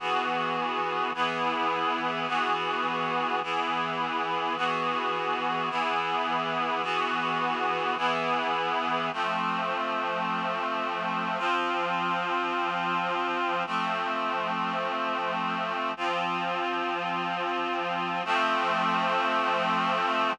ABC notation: X:1
M:3/4
L:1/8
Q:1/4=79
K:Emix
V:1 name="Clarinet"
[E,B,FG]3 [E,B,EG]3 | [E,B,FG]3 [E,B,EG]3 | [E,B,FG]3 [E,B,EG]3 | [E,B,FG]3 [E,B,EG]3 |
[K:Fmix] [F,A,C]6 | [F,CF]6 | [F,A,C]6 | [F,CF]6 |
[F,A,C]6 |]